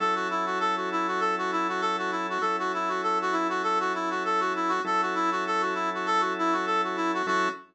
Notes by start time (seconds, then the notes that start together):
0.00 F#3 C#4 E4 A4
0.15 F#4
0.30 E4
0.46 F#4
0.60 A4
0.77 F#4
0.92 E4
1.07 F#4
1.20 A4
1.38 F#4
1.52 E4
1.69 F#4
1.81 A4
1.98 F#4
2.11 E4
2.30 F#4
2.41 F#3 C#4 E4 A4
2.59 F#4
2.74 E4
2.89 F#4
3.03 A4
3.22 F#4
3.32 E4
3.49 F#4
3.63 A4
3.80 F#4
3.94 E4
4.10 F#4
4.25 A4
4.40 F#4
4.56 E4
4.69 F#4
4.84 F#3 C#4 E4 A4
5.02 F#4
5.15 E4
5.32 F#4
5.47 A4
5.61 F#4
5.74 E4
5.94 F#4
6.06 A4
6.20 F#4
6.39 E4
6.53 F#4
6.66 A4
6.84 F#4
6.96 E4
7.14 F#4
7.27 F#3 C#4 E4 F#4 A4